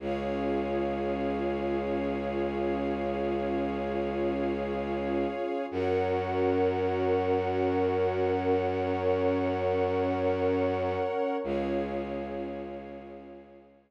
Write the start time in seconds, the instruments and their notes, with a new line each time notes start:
0.00 violin C#2, pad 2 (warm) C#4 F4 G#4, string ensemble 1 G#4 C#5 F5
5.71 violin F#2, pad 2 (warm) C#4 F#4 A#4, string ensemble 1 A#4 C#5 F#5
8.56 pad 2 (warm) C#4 A#4 C#5
11.44 violin C#2, pad 2 (warm) C#4 F4 G#4, string ensemble 1 G#4 C#5 F5